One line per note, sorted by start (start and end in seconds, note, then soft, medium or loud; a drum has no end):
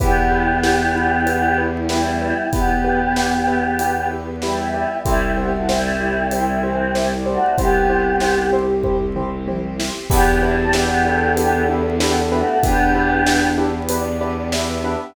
0.00 2.33 E2 medium
0.00 1.61 B3 medium
0.00 2.50 B3 medium
0.00 1.84 E4 medium
0.00 0.13 E4 medium
0.00 2.50 E4 medium
0.00 1.61 G4 medium
0.00 0.13 G4 medium
0.00 2.50 G4 medium
0.00 0.13 B4 loud
0.00 kick loud
0.00 closed hi-hat loud
0.32 0.44 E4 medium
0.32 0.44 G4 medium
0.32 0.44 B4 medium
0.63 0.76 E4 medium
0.63 0.76 G4 medium
0.63 0.76 B4 medium
0.63 snare loud
0.95 1.08 E4 medium
0.95 1.08 G4 medium
0.95 1.08 B4 medium
1.26 1.39 E4 medium
1.26 1.39 G4 medium
1.26 1.39 B4 medium
1.26 closed hi-hat loud
1.58 1.70 E4 medium
1.58 1.70 G4 medium
1.58 1.70 B4 medium
1.89 2.46 G3 medium
1.89 2.46 E4 medium
1.89 2.02 E4 medium
1.89 2.43 E4 medium
1.89 2.02 G4 medium
1.89 2.02 B4 medium
1.89 snare loud
2.21 2.34 E4 medium
2.21 2.34 G4 medium
2.21 2.34 B4 medium
2.52 4.85 E2 medium
2.52 3.66 B3 medium
2.52 4.08 B3 medium
2.52 5.03 B3 medium
2.52 2.66 E4 medium
2.52 4.08 G4 medium
2.52 5.03 G4 medium
2.52 2.66 G4 medium
2.52 5.03 B4 medium
2.52 2.66 B4 medium
2.52 kick loud
2.52 closed hi-hat loud
2.84 2.97 E4 medium
2.84 2.97 G4 medium
2.84 2.97 B4 medium
3.16 3.29 E4 medium
3.16 3.29 G4 medium
3.16 3.29 B4 medium
3.16 snare loud
3.48 3.60 E4 medium
3.48 3.60 G4 medium
3.48 3.60 B4 medium
3.79 3.92 E4 medium
3.79 3.92 G4 medium
3.79 4.34 B4 medium
3.79 3.92 B4 medium
3.79 closed hi-hat loud
4.10 4.23 E4 medium
4.10 4.23 G4 medium
4.10 4.23 B4 medium
4.42 4.96 G3 medium
4.42 4.96 E4 medium
4.42 4.55 E4 medium
4.42 4.55 G4 medium
4.42 4.55 B4 medium
4.42 4.68 E5 medium
4.42 snare loud
4.74 4.86 E4 medium
4.74 4.86 G4 medium
4.74 4.86 B4 medium
4.74 5.02 E5 medium
5.05 7.38 C2 medium
5.05 5.32 G3 medium
5.05 7.55 C4 medium
5.05 5.32 E4 medium
5.05 7.55 E4 medium
5.05 5.18 E4 medium
5.05 7.55 G4 medium
5.05 5.18 G4 loud
5.05 5.18 C5 medium
5.05 5.57 E5 medium
5.05 kick loud
5.05 closed hi-hat loud
5.37 5.52 B3 medium
5.37 5.49 E4 medium
5.37 5.49 G4 medium
5.37 5.52 G4 medium
5.37 5.49 C5 medium
5.53 5.68 A3 medium
5.53 5.68 F#4 medium
5.68 6.30 G3 medium
5.68 5.81 E4 medium
5.68 6.30 E4 medium
5.68 5.81 G4 medium
5.68 5.81 C5 medium
5.68 6.23 E5 medium
5.68 snare loud
6.00 6.13 E4 medium
6.00 6.13 G4 medium
6.00 6.13 C5 medium
6.31 6.62 G3 medium
6.31 6.62 E4 medium
6.31 6.45 E4 medium
6.31 6.45 G4 medium
6.31 6.45 C5 medium
6.31 6.73 E5 medium
6.31 closed hi-hat loud
6.63 6.93 E3 medium
6.63 6.93 C4 medium
6.63 6.76 E4 medium
6.63 6.76 G4 medium
6.63 6.76 C5 medium
6.73 7.11 C5 medium
6.94 7.09 G3 medium
6.94 7.09 E4 medium
6.94 7.07 E4 medium
6.94 7.07 G4 medium
6.94 7.07 C5 medium
6.94 snare loud
7.17 7.51 D5 medium
7.26 7.56 A3 medium
7.26 7.38 E4 medium
7.26 7.56 F#4 medium
7.26 7.38 G4 medium
7.26 7.38 C5 medium
7.57 9.90 C2 medium
7.57 8.47 B3 medium
7.57 10.07 C4 medium
7.57 7.71 E4 medium
7.57 10.07 G4 medium
7.57 7.71 G4 medium
7.57 8.47 G4 medium
7.57 9.05 G4 medium
7.57 10.07 C5 medium
7.57 7.71 C5 medium
7.57 kick loud
7.57 closed hi-hat loud
7.89 8.02 E4 medium
7.89 8.02 G4 medium
7.89 8.02 C5 medium
8.20 8.34 E4 medium
8.20 8.34 G4 medium
8.20 8.34 C5 medium
8.20 snare loud
8.53 8.65 E4 medium
8.53 8.65 G4 medium
8.53 8.65 C5 medium
8.83 8.97 E4 medium
8.83 8.97 G4 medium
8.83 8.97 C5 medium
8.83 kick medium
8.83 floor tom medium
9.16 9.29 E4 medium
9.16 9.29 G4 medium
9.16 9.29 C5 medium
9.16 mid tom medium
9.48 9.60 E4 medium
9.48 9.60 G4 medium
9.48 9.60 C5 medium
9.48 high tom loud
9.79 9.92 E4 medium
9.79 9.92 G4 medium
9.79 9.92 C5 medium
9.79 snare loud
10.10 12.43 E2 medium
10.10 10.40 B3 medium
10.10 12.61 B3 medium
10.10 10.23 D4 medium
10.10 12.61 D4 medium
10.10 10.23 E4 loud
10.10 12.61 E4 medium
10.10 10.23 G4 loud
10.10 10.40 G4 medium
10.10 12.61 G4 medium
10.10 10.89 G4 medium
10.10 10.23 B4 medium
10.10 kick loud
10.10 crash loud
10.42 10.57 G3 medium
10.42 10.55 D4 medium
10.42 10.57 E4 medium
10.42 10.55 E4 medium
10.42 10.55 G4 medium
10.42 10.55 B4 medium
10.57 10.72 C4 medium
10.57 10.72 A4 medium
10.73 11.30 B3 medium
10.73 10.87 D4 medium
10.73 10.87 E4 medium
10.73 11.30 G4 medium
10.73 10.87 G4 medium
10.73 10.87 B4 medium
10.73 snare loud
11.05 11.17 D4 medium
11.05 11.17 E4 medium
11.05 11.17 G4 medium
11.05 11.92 A4 medium
11.05 11.17 B4 medium
11.37 11.65 B3 medium
11.37 11.49 D4 medium
11.37 11.49 E4 medium
11.37 11.49 G4 medium
11.37 11.65 G4 medium
11.37 11.49 B4 medium
11.37 closed hi-hat loud
11.68 11.81 D4 medium
11.68 11.81 E4 medium
11.68 11.81 G4 medium
11.68 11.81 B4 medium
12.00 12.15 B3 medium
12.00 12.13 D4 medium
12.00 12.13 E4 medium
12.00 12.15 G4 medium
12.00 12.13 G4 medium
12.00 12.54 A4 medium
12.00 12.13 B4 medium
12.00 snare loud
12.31 12.62 A3 medium
12.31 12.44 D4 medium
12.31 12.44 E4 medium
12.31 12.62 F#4 medium
12.31 12.44 G4 medium
12.31 12.44 B4 medium
12.63 14.96 E2 medium
12.63 15.13 B3 medium
12.63 13.47 B3 medium
12.63 15.13 D4 medium
12.63 12.76 D4 medium
12.63 13.68 D4 medium
12.63 12.76 E4 medium
12.63 15.13 G4 medium
12.63 12.76 G4 medium
12.63 13.47 G4 medium
12.63 15.13 B4 medium
12.63 12.76 B4 medium
12.63 kick loud
12.63 closed hi-hat loud
12.95 13.07 D4 medium
12.95 13.07 E4 medium
12.95 13.07 G4 medium
12.95 13.07 B4 medium
13.26 13.38 D4 medium
13.26 13.38 E4 medium
13.26 13.38 G4 medium
13.26 13.38 B4 medium
13.26 snare loud
13.58 13.70 D4 medium
13.58 13.70 E4 medium
13.58 13.70 G4 medium
13.58 13.70 B4 medium
13.89 14.02 D4 medium
13.89 14.02 E4 medium
13.89 14.02 G4 medium
13.89 14.02 B4 medium
13.89 14.49 D5 medium
13.89 closed hi-hat loud
14.21 14.34 D4 medium
14.21 14.34 E4 medium
14.21 14.34 G4 medium
14.21 14.34 B4 medium
14.52 14.65 D4 medium
14.52 14.65 E4 medium
14.52 14.65 G4 medium
14.52 14.65 B4 medium
14.52 14.83 E5 medium
14.52 snare loud
14.84 14.97 D4 medium
14.84 14.97 E4 medium
14.84 14.97 G4 medium
14.84 14.97 B4 medium
14.84 15.14 E5 medium